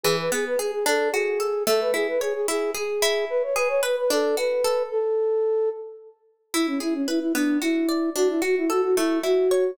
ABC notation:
X:1
M:6/8
L:1/16
Q:3/8=74
K:Emix
V:1 name="Flute"
G B G B G G A2 G4 | A B G B G G G2 G4 | B c B c B B A2 B4 | A6 z6 |
E C E C E E D2 E4 | F E F E F F E2 F4 |]
V:2 name="Pizzicato Strings"
E,2 B,2 G2 D2 F2 A2 | A,2 E2 c2 E2 G2 E2- | E2 G2 B2 D2 F2 A2 | z12 |
E2 G2 B2 B,2 F2 d2 | D2 F2 A2 A,2 E2 c2 |]